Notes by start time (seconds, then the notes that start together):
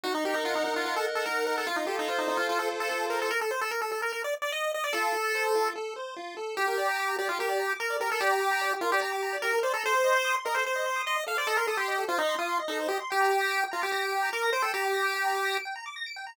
0.03 D#4 F#4
0.15 D#4
0.25 G4 A#4
0.34 D#4
0.45 F4 F#5
0.55 D#4
0.64 D#4
0.76 F4
0.85 F4 A#4
0.96 A4
1.06 F#5
1.15 A4
1.26 D#4 A#4
1.47 A#4
1.58 A4
1.67 F4
1.76 D#4
1.87 G4 A4
1.99 D#4
2.08 F4 C5
2.18 D#4
2.28 D#4 F4
2.37 F4
2.49 F4 A4
2.59 A4
2.70 C5
2.80 A4
2.89 F4 A4
3.10 A4 A#4
3.22 A4
3.31 A#4
3.41 A4
3.51 C5
3.61 A4
3.71 A#4
3.82 A4
3.92 A4
4.02 A#4
4.12 A#4
4.24 D5
4.42 D5
4.52 D#5
4.74 D#5
4.84 D5
4.93 F4 A4
5.14 A4
5.35 C5
5.55 F4
5.76 A4
5.96 C5
6.16 F4
6.37 A4
6.57 G4
6.67 A#4
6.78 D5
6.88 A#5
6.98 D6
7.08 A#5
7.19 G4 D5
7.29 F4 G4
7.39 G4 A#4
7.49 D5
7.59 A#5
7.70 D6
7.80 A#4 A#5
7.90 D5
8.00 G4 A#4
8.10 A4 A#4
8.20 G4 D5
8.31 A#5
8.41 D6
8.51 A#5
8.61 D5
8.72 G4
8.81 F4 A#4
8.92 G4 D5
9.01 G4 A#5
9.12 D6
9.23 A#5
9.33 D5
9.42 G4 A#4
9.53 A#4
9.63 C5 D5
9.74 A4 A#5
9.84 A4 C5
9.94 C5
10.04 D#5
10.14 C6
10.25 D#6
10.35 C6
10.45 A#4 D#5
10.55 A4 C5
10.65 C5
10.76 D#5
10.86 C6
10.96 D#6
11.06 D#5 C6
11.16 D#5
11.27 A4 F5
11.37 C5 D5
11.47 A4 D#5
11.57 A#4 C6
11.67 A4 D#6
11.77 G4 C6
11.88 D#5
11.98 A4
12.08 F4 C5
12.18 D#4 D#5
12.29 C6
12.39 F4 D#6
12.49 C6
12.59 D#5
12.68 D#4 A4
12.80 C5
12.88 G4 D#5
13.00 C6
13.10 G4 G5
13.21 A#5
13.31 D6
13.41 A#6
13.51 D7
13.61 G5
13.71 F4 A#5
13.82 G4 D6
13.92 G4 A#6
14.02 D7
14.12 G5
14.23 A#5
14.33 A#4 D6
14.43 A#6
14.53 C5 D7
14.62 A4 G5
14.74 G4 A#5
14.84 D6
14.94 A#6
15.04 D7
15.14 G5
15.25 A#5
15.35 D6
15.45 A#6
15.55 D7
15.65 G5
15.76 A#5
15.86 D6
15.96 A#6
16.06 D7
16.16 G5
16.27 A#5